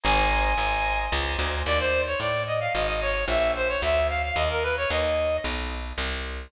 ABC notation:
X:1
M:3/4
L:1/16
Q:1/4=111
K:Abmix
V:1 name="Clarinet"
a8 z4 | [K:Ebmix] =d c2 ^c d2 e f e e _d2 | _f2 c d f2 =f f e B _c d | e4 z8 |]
V:2 name="Drawbar Organ"
[ceab]4 [ceab]4 [ceab]4 | [K:Ebmix] z12 | z12 | z12 |]
V:3 name="Electric Bass (finger)" clef=bass
A,,,4 A,,,4 D,,2 =D,,2 | [K:Ebmix] E,,4 =A,,4 _A,,,4 | B,,,4 =D,,4 E,,4 | E,,4 =B,,,4 C,,4 |]